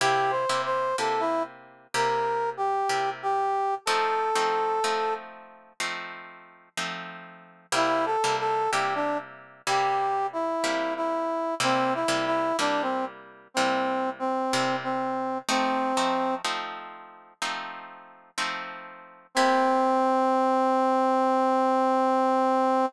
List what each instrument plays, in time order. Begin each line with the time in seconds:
0.01 acoustic guitar (steel) C3 A#3 E4 G4, brass section G4
0.31 brass section C5
0.49 acoustic guitar (steel) C3 A#3 E4 G4
0.65 brass section C5
0.98 acoustic guitar (steel) C3 A#3 E4 G4, brass section A4
1.20 brass section E4
1.94 acoustic guitar (steel) C3 A#3 E4 G4, brass section A#4
2.57 brass section G4
2.89 acoustic guitar (steel) C3 A#3 E4 G4
3.23 brass section G4
3.86 acoustic guitar (steel) F3 A3 C4 D#4, brass section A4
4.35 acoustic guitar (steel) F3 A3 C4 D#4
4.84 acoustic guitar (steel) F3 A3 C4 D#4
5.80 acoustic guitar (steel) F3 A3 C4 D#4
6.77 acoustic guitar (steel) F3 A3 C4 D#4
7.72 acoustic guitar (steel) C3 G3 A#3 E4, brass section E4
8.06 brass section A4
8.24 acoustic guitar (steel) C3 G3 A#3 E4
8.40 brass section A4
8.71 acoustic guitar (steel) C3 G3 A#3 E4, brass section G4
8.95 brass section D4
9.67 acoustic guitar (steel) C3 G3 A#3 E4, brass section G4
10.33 brass section E4
10.64 acoustic guitar (steel) C3 G3 A#3 E4
10.97 brass section E4
11.60 acoustic guitar (steel) C3 G3 A#3 E4, brass section C4
11.95 brass section E4
12.08 acoustic guitar (steel) C3 G3 A#3 E4
12.26 brass section E4
12.59 acoustic guitar (steel) C3 G3 A#3 E4, brass section D4
12.82 brass section C4
13.54 acoustic guitar (steel) C3 G3 A#3 E4, brass section C4
14.19 brass section C4
14.53 acoustic guitar (steel) C3 G3 A#3 E4
14.83 brass section C4
15.49 acoustic guitar (steel) F3 A3 C4 D#4, brass section C4
15.97 acoustic guitar (steel) F3 A3 C4 D#4
16.45 acoustic guitar (steel) F3 A3 C4 D#4
17.42 acoustic guitar (steel) F3 A3 C4 D#4
18.38 acoustic guitar (steel) F3 A3 C4 D#4
19.35 acoustic guitar (steel) C3 A#3 E4 G4, brass section C4